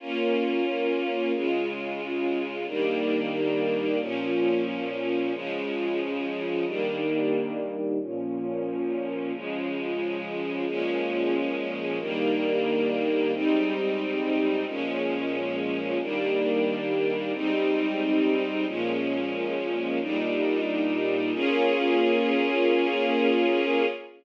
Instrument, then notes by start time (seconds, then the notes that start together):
string ensemble 1
0.00 A#3 C#4 F4
1.33 C#3 G#3 F4
2.67 D#3 G3 A#3 D4
4.00 A#2 F3 C#4
5.33 C#3 F3 G#3
6.66 D#3 G3 A#3 D4
8.00 A#2 F3 C#4
9.34 C#3 F3 G#3
10.67 A#2 F3 G#3 C#4
12.00 D#3 G3 A#3 D4
13.33 G#2 G3 C4 D#4
14.67 A#2 F3 G#3 C#4
16.00 D#3 G3 A#3 D4
17.33 G#2 G3 C4 D#4
18.67 A#2 F3 G#3 C#4
20.00 A#2 G3 D4 D#4
21.33 A#3 C#4 F4 G#4